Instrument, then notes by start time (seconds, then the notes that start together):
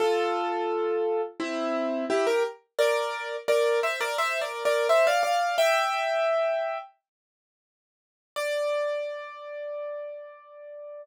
acoustic grand piano
0.00 F4 A4
1.40 C4 E4
2.10 E4 G4
2.27 G4 A#4
2.79 A#4 D5
3.48 A#4 D5
3.83 C5 E5
4.00 A#4 D5
4.18 C5 E5
4.41 A#4 D5
4.65 A#4 D5
4.89 C5 E5
5.07 D5 F5
5.23 D5 F5
5.58 E5 G5
8.36 D5